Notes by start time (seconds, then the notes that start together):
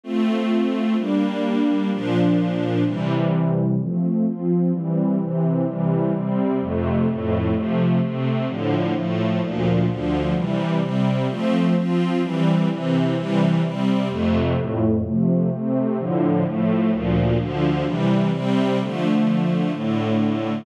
0.04 A3 C4 F4
0.97 G3 A#3 D4
1.91 A#2 F3 D4
2.85 C3 E3 G3
3.79 F3 A3 C4
4.25 F3 C4 F4
4.72 E3 G3 C4
5.19 C3 E3 C4
5.66 C3 E3 G3
6.13 C3 G3 C4
6.60 F2 C3 A3
7.07 F2 A2 A3
7.54 C3 F3 A3
8.00 C3 A3 C4
8.47 A2 D3 F3
8.94 A2 F3 A3
9.41 D2 A#2 F3
9.88 D2 D3 F3
10.35 C3 E3 G3
10.81 C3 G3 C4
11.29 F3 A3 C4
11.75 F3 C4 F4
12.22 E3 G3 C4
12.70 C3 E3 C4
13.16 C3 E3 G3
13.62 C3 G3 C4
14.10 F2 C3 A3
14.57 F2 A2 A3
15.03 C3 F3 A3
15.50 C3 A3 C4
15.97 A2 D3 F3
16.45 A2 F3 A3
16.91 D2 A#2 F3
17.38 D2 D3 F3
17.85 C3 E3 G3
18.32 C3 G3 C4
18.79 D3 F3 A3
19.72 A2 D3 A3